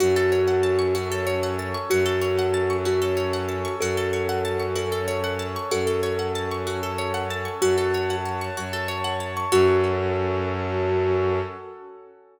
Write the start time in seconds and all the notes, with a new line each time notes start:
0.00 F#2 C#4 F#4 A4
0.16 A4
0.32 C#5
0.47 F#5
0.63 A5
0.79 C#6
0.95 C#4 F#4 A4 C#5
1.12 A4
1.27 C#5
1.43 F#5
1.59 A5
1.74 C#6
1.90 F#2 C#4 F#4 A4
2.06 A4
2.21 C#5
2.39 F#5
2.54 A5
2.70 C#6
2.85 C#4 F#4 A4 C#5
3.02 A4
3.17 C#5
3.33 F#5
3.49 A5
3.65 C#6
3.80 F#2 C#4 F#4 A4
3.97 A4
4.13 C#5
4.29 F#5
4.45 A5
4.60 C#6
4.76 C#4 F#4 A4 C#5
4.92 A4
5.08 C#5
5.24 F#5
5.39 A5
5.56 C#6
5.71 F#2 C#4 F#4 A4
5.87 A4
6.03 C#5
6.19 F#5
6.35 A5
6.51 C#6
6.66 C#4 F#4 A4 C#5
6.83 A4
6.98 C#5
7.14 F#5
7.30 A5
7.45 C#6
7.61 F#2 F#4 C#5 F#5 A5
7.78 A4
7.94 C#5
8.10 F#5
8.25 A5
8.41 C#6
8.56 F#2 F#4 C#5 A5 C#6
8.73 A4
8.88 C#5
9.04 F#5
9.20 A5
9.37 C#6
9.52 F#2 C#4 F#4 A4 C#5